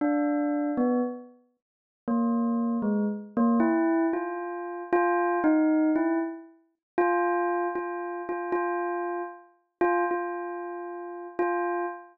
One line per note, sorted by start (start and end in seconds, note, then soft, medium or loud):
0.01 0.71 D4 medium
0.77 1.01 B3 medium
2.08 2.78 A#3 medium
2.82 3.06 G#3 medium
3.37 3.60 A#3 loud
3.60 4.06 E4 medium
4.13 4.83 F4 medium
4.93 5.39 F4 loud
5.44 5.91 D#4 medium
5.96 6.19 E4 medium
6.98 7.68 F4 loud
7.75 8.22 F4 medium
8.29 8.52 F4 medium
8.52 9.22 F4 medium
9.81 10.04 F4 loud
10.11 11.27 F4 medium
11.39 11.86 F4 medium